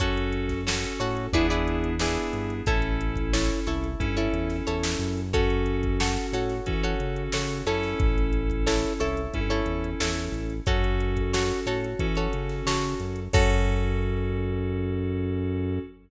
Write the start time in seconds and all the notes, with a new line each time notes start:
0.00 F#2 C#4 F#4 A4 C#5, kick, closed hi-hat
0.17 closed hi-hat
0.32 closed hi-hat
0.49 kick, snare, closed hi-hat
0.66 C#4 F#4 A4 C#5, snare
0.84 closed hi-hat
1.00 A2 F#4 A4 C#5, closed hi-hat
1.17 closed hi-hat
1.33 E2 B3 D4 E4 G#4 B4 D5, kick, closed hi-hat
1.50 E4 G#4 B4 D5
1.68 closed hi-hat
1.84 closed hi-hat
1.99 B3 D4 E4 G#4 B4 D5, snare
2.16 closed hi-hat
2.33 G2, closed hi-hat
2.50 closed hi-hat
2.66 A1 C#4 E4 A4 C#5, kick, closed hi-hat
2.82 closed hi-hat
3.01 closed hi-hat
3.16 kick, closed hi-hat
3.33 E4 A4 C#5, snare
3.50 closed hi-hat
3.67 C2 E4 A4 C#5, closed hi-hat
3.84 closed hi-hat
4.00 G2 C#4 E4 A4, kick, closed hi-hat
4.17 E4 A4 C#5, closed hi-hat
4.33 E2, closed hi-hat
4.50 snare, closed hi-hat
4.67 E2 E4 A4 C#5, closed hi-hat
4.83 snare
4.99 F#2, closed hi-hat
5.17 closed hi-hat
5.33 C#4 F#4 A4 C#5, kick, closed hi-hat
5.50 closed hi-hat
5.66 closed hi-hat
5.83 kick, closed hi-hat
6.00 F#4 A4 C#5, snare
6.17 snare, closed hi-hat
6.32 A2 F#4 A4 C#5, closed hi-hat
6.49 snare, closed hi-hat
6.66 E3 C#4 F#4 A4, kick, closed hi-hat
6.83 F#4 A4 C#5, closed hi-hat
7.00 C#3, closed hi-hat
7.16 closed hi-hat
7.32 C#3 F#4 A4 C#5, snare
7.51 closed hi-hat
7.66 F#2 C#4 E4 A4 C#5, closed hi-hat
7.83 snare, closed hi-hat
8.00 A1, kick, closed hi-hat
8.18 closed hi-hat
8.33 closed hi-hat
8.50 kick, closed hi-hat
8.67 E4 A4 C#5, snare
8.84 closed hi-hat
9.00 C2 E4 A4 C#5, closed hi-hat
9.17 closed hi-hat
9.33 G2 C#4 E4 A4, kick, closed hi-hat
9.50 E4 A4 C#5, closed hi-hat
9.66 E2, closed hi-hat
9.84 closed hi-hat
10.00 E2 E4 A4 C#5, snare
10.17 closed hi-hat
10.32 A1, closed hi-hat
10.50 closed hi-hat
10.66 F#2 C#4 F#4 A4 C#5, kick, closed hi-hat
10.84 closed hi-hat
11.00 closed hi-hat
11.17 kick, closed hi-hat
11.33 F#4 A4 C#5, snare
11.50 closed hi-hat
11.66 A2 F#4 A4 C#5, closed hi-hat
11.84 closed hi-hat
11.99 E3 C#4 F#4 A4, kick, closed hi-hat
12.15 F#4 A4 C#5, closed hi-hat
12.33 C#3, closed hi-hat
12.49 snare, closed hi-hat
12.66 C#3 F#4 A4 C#5, snare
12.83 closed hi-hat
13.00 F#2, closed hi-hat
13.16 closed hi-hat
13.33 F#2 C#4 F#4 A4 C#5, kick, crash